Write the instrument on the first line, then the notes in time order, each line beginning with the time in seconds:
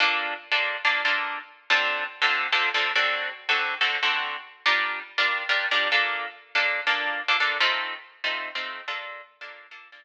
acoustic guitar (steel)
0.00 A#3 D4 F4 A4
0.52 A#3 D4 F4 A4
0.85 A#3 D4 F4 A4
1.05 A#3 D4 F4 A4
1.70 D3 C4 F4 A4
2.22 D3 C4 F4 A4
2.52 D3 C4 F4 A4
2.74 D3 C4 F4 A4
2.96 D3 C4 F#4 A4
3.49 D3 C4 F#4 A4
3.81 D3 C4 F#4 A4
4.03 D3 C4 F#4 A4
4.66 G3 D4 F4 A#4
5.18 G3 D4 F4 A#4
5.49 G3 D4 F4 A#4
5.71 G3 D4 F4 A#4
5.92 A#3 D4 F4 A4
6.55 A#3 D4 F4 A4
6.87 A#3 D4 F4 A4
7.28 A#3 D4 F4 A4
7.40 A#3 D4 F4 A4
7.60 A3 C4 D#4 F4
8.24 A3 C4 D#4 F4
8.55 A3 C4 D#4 F4
8.88 A#3 D4 F4 A4
9.41 A#3 D4 F4 A4
9.71 A#3 D4 F4 A4
9.92 A#3 D4 F4 A4